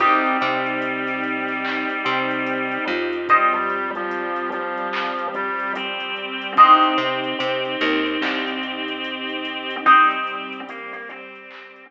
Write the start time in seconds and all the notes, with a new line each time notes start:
0.00 C2 G3 C4 D#4 G4, kick, closed hi-hat
0.25 closed hi-hat
0.41 C3 C4, closed hi-hat
0.66 closed hi-hat
0.82 closed hi-hat
1.07 snare, closed hi-hat
1.24 closed hi-hat
1.48 snare, closed hi-hat
1.65 clap
1.90 closed hi-hat
2.05 C3 C4, closed hi-hat
2.31 closed hi-hat
2.47 closed hi-hat
2.72 closed hi-hat
2.88 F2 F3, closed hi-hat
3.13 closed hi-hat
3.28 G3 C4 G4 C5 D#5, kick, closed hi-hat
3.54 G3, closed hi-hat
3.70 closed hi-hat
3.95 F3, closed hi-hat
4.11 closed hi-hat
4.36 closed hi-hat
4.52 F3, closed hi-hat
4.78 closed hi-hat
4.93 clap
5.19 closed hi-hat
5.34 G3, closed hi-hat
5.60 closed hi-hat
5.75 C4, closed hi-hat
6.00 closed hi-hat
6.16 closed hi-hat
6.42 closed hi-hat
6.57 C2 C4 D#4 G4 C5 D#5, kick, closed hi-hat
6.83 closed hi-hat
6.98 C3 C4, closed hi-hat
7.24 closed hi-hat
7.39 C3 C4, closed hi-hat
7.65 closed hi-hat
7.81 D#2 D#3, closed hi-hat
8.06 closed hi-hat
8.21 C2 C3, clap
8.48 closed hi-hat
8.63 closed hi-hat
8.88 closed hi-hat
9.04 closed hi-hat
9.29 closed hi-hat
9.45 closed hi-hat
9.71 closed hi-hat
9.86 G3 C4 D#4 G4, kick, closed hi-hat
10.11 closed hi-hat
10.27 closed hi-hat
10.53 closed hi-hat
10.69 A#3, closed hi-hat
10.93 A#3, closed hi-hat
11.09 C4, closed hi-hat
11.35 closed hi-hat
11.51 clap
11.76 closed hi-hat